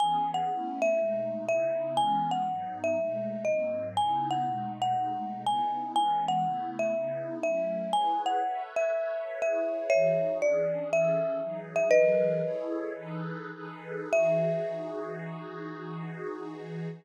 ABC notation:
X:1
M:4/4
L:1/8
Q:"Swing" 1/4=121
K:E
V:1 name="Marimba"
g f2 e3 e2 | g f2 e3 d2 | g f2 f3 g2 | g f2 e3 e2 |
g f2 e3 e2 | [ce]2 =d2 e3 e | "^rit." [Bd]5 z3 | e8 |]
V:2 name="Pad 2 (warm)"
[E,B,CG]2 [A,B,CE]2 [B,,G,A,D]2 [C,B,DE]2 | [E,G,B,C]2 [G,,F,B,D]2 [B,,G,A,D]2 [G,,F,^A,^B,]2 | [C,B,DE]2 [B,,G,A,D]2 [B,,G,A,D]2 [C,B,DE]2 | [E,G,B,C]2 [C,A,B,E]2 [C,B,DE]2 [F,A,CE]2 |
[EGBc]2 [ABce]2 [ABce]2 [EGBc]2 | [E,DFG]2 [E,C=DG]2 [E,CGA]2 [E,F,^DG]2 | "^rit." [E,F,G^AB]2 [EG=Ac]2 [E,DGAB]2 [E,DGAB]2 | [E,DFG]8 |]